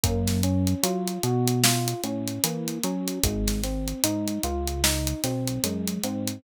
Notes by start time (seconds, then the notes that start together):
0.04 F#2 A#3, kick, closed hi-hat
0.27 snare, closed hi-hat
0.43 C#4, closed hi-hat
0.67 closed hi-hat
0.83 F#3 F4, closed hi-hat
1.08 closed hi-hat
1.23 B2 F#4, closed hi-hat
1.48 closed hi-hat
1.64 F4, snare
1.88 closed hi-hat
2.04 A2 C#4, closed hi-hat
2.28 closed hi-hat
2.44 E3 A#3, closed hi-hat
2.68 closed hi-hat
2.83 F#3 C#4, closed hi-hat
3.08 closed hi-hat
3.23 G#1 G#3, kick, closed hi-hat
3.48 snare, closed hi-hat
3.64 C4, snare, closed hi-hat
3.88 closed hi-hat
4.04 G#2 D#4, closed hi-hat
4.28 closed hi-hat
4.43 C#2 F4, closed hi-hat
4.68 closed hi-hat
4.84 D#4, snare
5.07 closed hi-hat
5.24 B1 C4, snare, closed hi-hat
5.48 closed hi-hat
5.64 F#2 G#3, closed hi-hat
5.88 closed hi-hat
6.04 G#2 C4, closed hi-hat
6.28 closed hi-hat